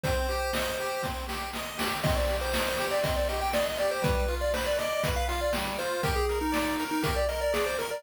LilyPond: <<
  \new Staff \with { instrumentName = "Lead 1 (square)" } { \time 4/4 \key c \minor \tempo 4 = 120 c''2~ c''8 r4. | ees''16 d''8 c''4 d''16 ees''16 d''16 ees''16 g''16 d''16 ees''16 d''16 c''16 | b'8. d''16 c''16 d''16 ees''8. f''16 f''16 d''16 r8 c''8 | bes'16 aes'8 ees'4 ees'16 bes'16 d''16 ees''16 d''16 aes'16 c''16 bes'16 d''16 | }
  \new Staff \with { instrumentName = "Lead 1 (square)" } { \time 4/4 \key c \minor c'8 g'8 ees''8 g'8 c'8 g'8 ees''8 g'8 | c'8 g'8 ees''8 g'8 c'8 g'8 ees''8 g'8 | g8 f'8 b'8 d''8 b'8 f'8 g8 f'8 | g'8 bes'8 d''8 bes'8 g'8 bes'8 d''8 bes'8 | }
  \new DrumStaff \with { instrumentName = "Drums" } \drummode { \time 4/4 <hh bd>8 hh8 sn4 <bd sn>8 sn8 sn8 sn8 | <cymc bd>8 hh8 sn8 hh8 <hh bd>8 hh8 sn8 hh8 | <hh bd>8 hh8 sn8 hh8 <hh bd>8 hh8 sn8 hh8 | <hh bd>8 hh8 sn8 hh8 <hh bd>8 hh8 sn8 hh8 | }
>>